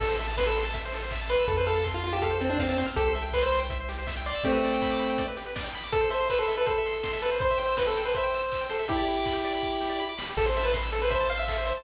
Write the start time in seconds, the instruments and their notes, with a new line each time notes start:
0.00 synth bass 1 A1, lead 1 (square) A4, kick, crash
0.08 lead 1 (square) C5
0.19 lead 1 (square) E5, open hi-hat
0.28 lead 1 (square) A5
0.37 lead 1 (square) B4 C6, kick, snare
0.46 lead 1 (square) A4 E6
0.56 lead 1 (square) C6, open hi-hat
0.65 lead 1 (square) A5
0.73 lead 1 (square) E5, kick, closed hi-hat
0.85 lead 1 (square) C5
0.92 lead 1 (square) A4, open hi-hat
1.03 lead 1 (square) C5
1.11 lead 1 (square) E5, kick, clap
1.21 lead 1 (square) A5
1.29 lead 1 (square) B4 C6, open hi-hat
1.39 lead 1 (square) E6
1.48 synth bass 1 F2, lead 1 (square) A4, kick, closed hi-hat
1.57 lead 1 (square) B4 C5
1.66 lead 1 (square) A4 F5, open hi-hat
1.75 lead 1 (square) A5
1.84 lead 1 (square) C6, kick, clap
1.94 lead 1 (square) F4 F6
2.02 lead 1 (square) F4 C6, open hi-hat
2.13 lead 1 (square) G4 A5
2.22 lead 1 (square) A4 F5, kick, closed hi-hat
2.30 lead 1 (square) C5
2.41 lead 1 (square) C4 A4, open hi-hat
2.49 lead 1 (square) D4 C5
2.59 lead 1 (square) C4 F5, kick, snare
2.69 lead 1 (square) C4 A5
2.77 lead 1 (square) C4 C6, open hi-hat
2.86 lead 1 (square) F6
2.96 synth bass 1 C2, lead 1 (square) G4 A4, kick, closed hi-hat
3.07 lead 1 (square) C5
3.15 lead 1 (square) E5, open hi-hat
3.22 lead 1 (square) G5
3.33 lead 1 (square) B4 C6, kick, clap
3.43 lead 1 (square) C5 E6
3.52 lead 1 (square) C6, open hi-hat
3.59 lead 1 (square) G5
3.70 lead 1 (square) E5, kick, closed hi-hat
3.80 lead 1 (square) C5
3.89 lead 1 (square) G4, open hi-hat
3.99 lead 1 (square) C5
4.07 lead 1 (square) E5, kick, snare
4.17 lead 1 (square) G5
4.26 lead 1 (square) D5 C6, open hi-hat
4.35 lead 1 (square) E6
4.44 lead 1 (square) A3 C4 G4, kick, closed hi-hat
4.52 lead 1 (square) B4
4.63 lead 1 (square) D5, open hi-hat
4.74 lead 1 (square) G5
4.82 lead 1 (square) B5, kick, clap
4.91 lead 1 (square) D6
4.99 lead 1 (square) B5, open hi-hat
5.10 lead 1 (square) G5
5.18 lead 1 (square) D5, kick, closed hi-hat
5.28 lead 1 (square) B4
5.37 lead 1 (square) G4, open hi-hat
5.46 lead 1 (square) B4
5.56 lead 1 (square) D5, kick, snare
5.64 lead 1 (square) G5
5.74 lead 1 (square) B5, open hi-hat
5.84 lead 1 (square) D6
5.92 lead 1 (square) A4, kick, closed hi-hat
6.01 lead 1 (square) C5
6.10 lead 1 (square) C5 E5, open hi-hat
6.20 lead 1 (square) C6
6.30 lead 1 (square) B4 E6, kick, clap
6.38 lead 1 (square) A4 C6
6.48 lead 1 (square) E5, open hi-hat
6.57 lead 1 (square) A4 B4
6.66 lead 1 (square) A4 C5, kick, closed hi-hat
6.78 lead 1 (square) E5
6.86 lead 1 (square) C6, open hi-hat
6.94 lead 1 (square) E6
7.03 lead 1 (square) C6, kick, snare
7.13 lead 1 (square) E5
7.22 lead 1 (square) A4 B4, open hi-hat
7.31 lead 1 (square) C5
7.39 lead 1 (square) C5, kick, closed hi-hat
7.51 lead 1 (square) E5
7.58 lead 1 (square) C5 G5, open hi-hat
7.68 lead 1 (square) E6
7.77 lead 1 (square) B4 G6, kick, snare
7.87 lead 1 (square) A4 E6
7.96 lead 1 (square) G5, open hi-hat
8.04 lead 1 (square) B4 C5
8.15 lead 1 (square) C5 E5, kick, closed hi-hat
8.23 lead 1 (square) G5
8.34 lead 1 (square) E6, open hi-hat
8.43 lead 1 (square) G6
8.52 lead 1 (square) E6, kick, clap
8.61 lead 1 (square) G5
8.69 lead 1 (square) A4 C5, open hi-hat
8.79 lead 1 (square) E5
8.88 lead 1 (square) E4 G4, kick, closed hi-hat
8.97 lead 1 (square) D5
9.07 lead 1 (square) B5, open hi-hat
9.17 lead 1 (square) D6
9.26 lead 1 (square) B5, kick, clap
9.33 lead 1 (square) G4
9.44 lead 1 (square) D5, open hi-hat
9.55 lead 1 (square) B5
9.63 lead 1 (square) D6, kick
9.72 lead 1 (square) B5
9.81 lead 1 (square) G4, snare
9.89 lead 1 (square) D5
10.00 lead 1 (square) B5
10.09 lead 1 (square) D6
10.18 lead 1 (square) B5, snare
10.29 lead 1 (square) G4
10.37 synth bass 1 A1, lead 1 (square) A4, kick, crash
10.45 lead 1 (square) C5
10.55 lead 1 (square) E5, open hi-hat
10.64 lead 1 (square) B4 A5
10.74 lead 1 (square) C6, kick, snare
10.83 lead 1 (square) E6
10.92 lead 1 (square) A4, open hi-hat
11.02 lead 1 (square) B4 C5
11.10 lead 1 (square) C5 E5, kick, closed hi-hat
11.20 lead 1 (square) A5
11.29 lead 1 (square) F5 C6, open hi-hat
11.37 lead 1 (square) E5 E6
11.48 lead 1 (square) A4, kick, clap
11.58 lead 1 (square) C5
11.65 lead 1 (square) C5 E5, open hi-hat
11.77 lead 1 (square) A5